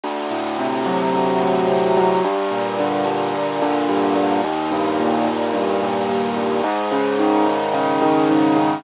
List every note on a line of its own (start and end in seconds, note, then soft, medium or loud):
0.04 1.13 D2 medium
0.31 1.41 A2 medium
0.59 1.67 C3 medium
0.86 1.97 F#3 medium
1.14 2.18 D2 medium
1.42 2.20 A2 medium
1.68 2.20 C3 medium
1.97 2.23 F#3 medium
2.24 3.05 G2 medium
2.51 3.33 A#2 medium
2.79 3.61 D3 medium
3.05 3.88 G2 medium
3.34 4.15 A#2 medium
3.62 4.40 D3 medium
3.89 4.41 G2 medium
4.16 4.42 A#2 medium
4.44 5.26 D#2 medium
4.71 5.53 G2 medium
5.00 5.82 A#2 medium
5.27 6.09 D#2 medium
5.53 6.36 G2 medium
5.82 6.61 A#2 medium
6.09 6.62 D#2 medium
6.36 6.63 G2 medium
6.64 7.46 G#2 medium
6.92 7.73 C#3 medium
7.19 8.01 D#3 medium
7.46 8.29 G#2 medium
7.74 8.56 C#3 medium
8.02 8.80 D#3 medium
8.30 8.82 G#2 medium
8.56 8.83 C#3 medium